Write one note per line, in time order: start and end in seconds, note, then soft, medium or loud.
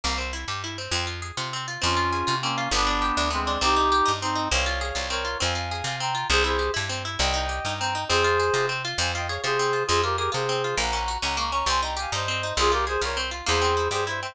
0.04 0.45 C2 loud
0.04 0.17 A#3 medium
0.18 0.31 C4 medium
0.33 0.46 E4 medium
0.48 0.88 G2 medium
0.48 0.62 G4 medium
0.64 0.77 E4 medium
0.78 0.92 C4 medium
0.91 1.32 F2 loud
0.91 1.06 C4 medium
1.07 1.20 F4 medium
1.22 1.36 G#4 medium
1.37 1.78 C3 medium
1.37 1.51 F4 medium
1.53 1.67 C4 medium
1.68 1.81 F4 medium
1.82 2.24 F2 loud
1.82 1.95 C4 medium
1.82 2.35 C#4 medium
1.82 2.35 F4 medium
1.97 2.10 F4 medium
2.12 2.26 G#4 medium
2.27 2.68 C3 medium
2.27 2.40 F4 medium
2.41 2.69 A#3 medium
2.41 2.57 C4 medium
2.41 2.69 C#4 medium
2.58 2.71 F4 medium
2.71 3.12 G1 loud
2.71 2.86 B3 loud
2.71 3.29 B3 medium
2.71 3.29 D4 medium
2.87 3.00 D4 medium
3.02 3.15 G4 medium
3.17 3.57 D2 loud
3.17 3.31 D4 medium
3.30 3.58 G#3 medium
3.30 3.44 B3 medium
3.30 3.58 C4 medium
3.47 3.61 D4 medium
3.61 4.02 C2 loud
3.61 3.75 C4 loud
3.61 4.12 D#4 medium
3.61 4.12 G4 medium
3.76 3.90 D#4 medium
3.92 4.05 G4 medium
4.06 4.48 G2 medium
4.06 4.19 D#4 medium
4.21 4.48 C4 medium
4.21 4.36 C4 medium
4.21 4.48 D#4 medium
4.35 4.49 D#4 medium
4.51 4.92 C2 loud
4.51 4.65 C4 loud
4.51 5.07 C#5 medium
4.51 5.07 F5 medium
4.66 4.80 F4 medium
4.81 4.95 G#4 medium
4.95 5.36 C2 medium
4.95 5.08 F4 medium
5.10 5.24 C4 medium
5.10 5.37 A#4 medium
5.10 5.37 C#5 medium
5.25 5.38 F4 medium
5.40 5.82 F2 loud
5.40 5.54 C4 loud
5.40 5.96 F5 medium
5.40 5.96 G#5 medium
5.55 5.69 F4 medium
5.71 5.85 G#4 medium
5.84 6.24 C3 medium
5.84 6.00 F4 medium
6.00 6.14 C4 medium
6.00 6.27 G5 medium
6.00 6.27 A#5 medium
6.15 6.28 F4 medium
6.30 6.70 C2 loud
6.30 6.44 C4 loud
6.30 6.43 G#4 medium
6.30 6.43 C5 medium
6.44 6.57 E4 medium
6.44 6.71 G#4 medium
6.44 6.71 C5 medium
6.59 6.72 G4 medium
6.74 7.17 G2 medium
6.74 6.87 E4 medium
6.89 7.03 C4 medium
7.05 7.18 E4 medium
7.19 7.60 C2 loud
7.19 7.32 C4 loud
7.19 7.74 D#5 medium
7.19 7.74 G5 medium
7.34 7.47 D#4 medium
7.49 7.62 G4 medium
7.65 8.05 G2 medium
7.65 7.79 D#4 medium
7.78 7.94 C4 medium
7.78 8.04 G5 medium
7.78 8.04 A#5 medium
7.95 8.08 D#4 medium
8.09 8.50 F2 loud
8.09 8.23 C4 loud
8.09 8.66 G#4 medium
8.09 8.66 C5 medium
8.24 8.38 F4 medium
8.40 8.53 G#4 medium
8.54 8.94 C3 medium
8.54 8.68 F4 medium
8.69 8.82 C4 medium
8.85 8.98 F4 medium
8.98 9.38 F2 loud
8.98 9.12 C4 loud
8.98 9.12 F5 medium
8.98 9.12 G#5 medium
9.15 9.28 F4 medium
9.15 9.27 D#5 medium
9.15 9.27 G5 medium
9.28 9.43 G#4 medium
9.28 9.41 C#5 medium
9.28 9.41 F5 medium
9.44 9.84 C3 medium
9.44 9.57 F4 medium
9.44 9.83 G#4 medium
9.44 9.83 C5 medium
9.59 9.73 C4 medium
9.73 9.87 F4 medium
9.87 10.29 F2 loud
9.87 10.02 C4 loud
9.87 10.01 F4 medium
9.87 10.01 G#4 medium
10.03 10.17 F4 medium
10.03 10.16 G4 medium
10.03 10.16 A#4 medium
10.17 10.30 G4 medium
10.17 10.32 G#4 medium
10.17 10.30 A#4 medium
10.32 10.74 C3 medium
10.32 10.45 F4 medium
10.32 10.75 G#4 medium
10.32 10.75 C5 medium
10.49 10.62 C4 medium
10.64 10.78 F4 medium
10.77 11.18 A#1 loud
10.77 10.91 A#3 loud
10.77 11.18 F#5 medium
10.77 11.18 A#5 medium
10.93 11.07 C#4 medium
11.08 11.21 F#4 medium
11.22 11.63 C#2 medium
11.22 11.36 C#4 medium
11.22 11.36 F#5 medium
11.22 11.36 A#5 medium
11.37 11.51 A#3 loud
11.37 11.52 A#5 medium
11.37 11.52 C#6 medium
11.52 11.66 C#4 medium
11.52 11.65 A#5 medium
11.52 11.65 C#6 medium
11.66 12.07 C2 loud
11.66 11.81 C4 loud
11.66 11.81 G#5 medium
11.66 11.81 C6 medium
11.82 11.96 D#4 medium
11.82 11.95 G5 medium
11.82 11.95 A#5 medium
11.97 12.10 G4 medium
11.97 12.13 F5 medium
11.97 12.13 G#5 medium
12.12 12.53 G2 medium
12.12 12.26 D#4 medium
12.12 12.53 C5 medium
12.12 12.53 D#5 medium
12.28 12.42 C4 medium
12.43 12.57 D#4 medium
12.57 12.97 C2 loud
12.57 12.70 C4 loud
12.57 12.71 F4 medium
12.57 12.71 G#4 medium
12.72 12.85 F4 medium
12.72 12.85 G4 medium
12.72 12.85 A#4 medium
12.87 13.00 G#4 medium
12.87 13.02 G#4 medium
12.87 13.02 C5 medium
13.01 13.42 C2 medium
13.01 13.15 F4 medium
13.01 13.18 A#4 medium
13.01 13.18 C#5 medium
13.17 13.30 C4 medium
13.31 13.45 F4 medium
13.46 13.89 E2 loud
13.46 13.60 A#3 loud
13.46 13.88 G#4 medium
13.46 13.88 C5 medium
13.62 13.75 C4 medium
13.77 13.90 E4 medium
13.91 14.31 G2 medium
13.91 14.05 G4 medium
13.91 14.04 G#4 medium
13.91 14.04 C5 medium
14.07 14.20 E4 medium
14.07 14.20 C5 medium
14.07 14.20 E5 medium
14.22 14.35 C4 medium
14.22 14.35 C5 medium
14.22 14.35 E5 medium